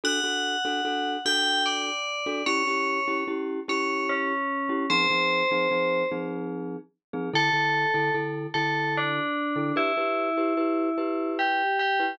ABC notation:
X:1
M:3/4
L:1/16
Q:1/4=74
K:D
V:1 name="Tubular Bells"
f6 g2 d4 | c4 z2 c2 C4 | =c6 z6 | A4 z2 A2 D4 |
E8 G2 G2 |]
V:2 name="Glockenspiel"
[DFA] [DFA]2 [DFA] [DFA]2 [DFA]5 [DFA] | [CEG] [CEG]2 [CEG] [CEG]2 [CEG]5 [CEG] | [=F,=C_E_A] [F,CEA]2 [F,CEA] [F,CEA]2 [F,CEA]5 [F,CEA] | [D,EA] [D,EA]2 [D,EA] [D,EA]2 [D,EA]5 [D,EA] |
[EGB] [EGB]2 [EGB] [EGB]2 [EGB]5 [EGB] |]